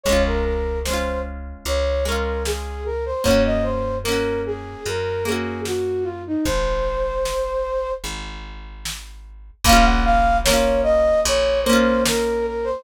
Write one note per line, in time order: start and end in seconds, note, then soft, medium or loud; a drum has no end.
0.04 1.53 C#2 medium
0.04 0.79 G#3 medium
0.04 0.23 C#5 medium
0.04 kick medium
0.04 closed hi-hat medium
0.09 0.79 C#4 medium
0.09 0.79 F4 medium
0.27 0.44 A#4 medium
0.45 0.79 A#4 medium
0.85 1.97 G#3 medium
0.85 1.20 C5 medium
0.85 snare medium
0.90 1.97 C#4 medium
0.90 1.97 F4 medium
1.65 3.13 C#2 medium
1.65 2.04 C#5 medium
1.65 closed hi-hat medium
2.05 3.16 G#3 medium
2.05 3.16 C#4 medium
2.05 2.43 A#4 medium
2.12 3.16 F4 medium
2.46 2.84 G#4 medium
2.46 snare medium
2.86 3.05 A#4 medium
3.06 3.25 C5 medium
3.24 4.73 F#2 medium
3.24 3.98 A#3 medium
3.24 3.98 C#4 medium
3.24 3.43 C#5 medium
3.24 kick medium
3.24 closed hi-hat medium
3.31 3.98 F#4 medium
3.45 3.64 D#5 medium
3.63 3.96 C5 medium
4.04 5.16 A#3 medium
4.04 4.41 A#4 medium
4.04 snare medium
4.08 5.16 C#4 medium
4.08 5.16 F#4 medium
4.46 4.84 G#4 medium
4.86 6.33 F#2 medium
4.86 5.25 A#4 medium
4.86 closed hi-hat medium
5.25 6.36 A#3 medium
5.25 6.36 C#4 medium
5.25 5.60 G#4 medium
5.32 6.36 F#4 medium
5.65 6.05 F#4 medium
5.65 snare medium
6.04 6.23 F4 medium
6.27 6.46 D#4 medium
6.45 7.93 G#1 medium
6.45 7.92 C5 medium
6.45 kick medium
6.45 closed hi-hat medium
7.25 snare medium
8.04 9.51 G#1 medium
8.04 closed hi-hat medium
8.85 snare loud
9.65 11.12 A#1 loud
9.65 10.40 A#3 loud
9.65 9.85 F5 loud
9.65 kick loud
9.65 closed hi-hat loud
9.69 10.40 C#4 loud
9.69 10.40 F4 loud
9.85 10.04 F#5 medium
10.05 10.37 F5 loud
10.45 11.58 A#3 loud
10.45 10.81 C#5 medium
10.45 snare loud
10.50 11.58 C#4 medium
10.50 11.58 F4 loud
10.83 11.20 D#5 loud
11.25 12.73 A#1 loud
11.25 11.60 C#5 medium
11.25 closed hi-hat loud
11.63 12.77 A#3 loud
11.63 12.02 C5 medium
11.70 12.77 C#4 loud
11.70 12.77 F4 loud
12.06 12.46 A#4 medium
12.06 snare loud
12.47 12.66 A#4 medium
12.64 12.83 C5 medium